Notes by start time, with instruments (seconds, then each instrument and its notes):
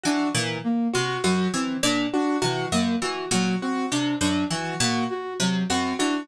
0.03 pizzicato strings E3, flute D4, acoustic grand piano F#4
0.34 pizzicato strings A#2, flute E3
0.64 flute A#3
0.93 pizzicato strings C3, acoustic grand piano F#4, flute F#4
1.24 pizzicato strings F#2, flute F#3, acoustic grand piano F#4
1.53 pizzicato strings E3, flute C4
1.83 pizzicato strings A#2, flute D4
2.13 flute D4, acoustic grand piano F#4
2.42 pizzicato strings C3, flute E3, acoustic grand piano F#4
2.72 pizzicato strings F#2, flute A#3
3.01 pizzicato strings E3, flute F#4
3.31 pizzicato strings A#2, flute F#3, acoustic grand piano F#4
3.62 flute C4, acoustic grand piano F#4
3.91 pizzicato strings C3, flute D4
4.21 pizzicato strings F#2, flute D4
4.50 flute E3, pizzicato strings E3, acoustic grand piano F#4
4.80 pizzicato strings A#2, flute A#3, acoustic grand piano F#4
5.10 flute F#4
5.40 pizzicato strings C3, flute F#3
5.69 pizzicato strings F#2, flute C4, acoustic grand piano F#4
5.99 pizzicato strings E3, flute D4, acoustic grand piano F#4